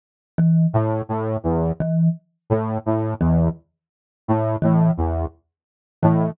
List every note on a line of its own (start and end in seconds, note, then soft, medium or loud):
0.38 0.66 E3 medium
0.74 1.02 A2 medium
1.09 1.37 A2 medium
1.44 1.72 E2 medium
1.80 2.09 E3 medium
2.50 2.78 A2 medium
2.86 3.14 A2 medium
3.21 3.49 E2 medium
3.21 3.49 E3 medium
4.28 4.56 A2 medium
4.62 4.91 A2 medium
4.62 4.90 E3 medium
4.97 5.26 E2 medium
6.02 6.31 A2 medium
6.02 6.31 E3 medium